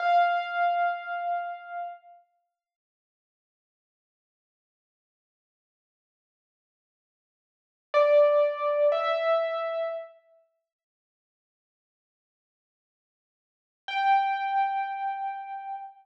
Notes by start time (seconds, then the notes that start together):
0.00 F5
7.94 D5
8.92 E5
13.88 G5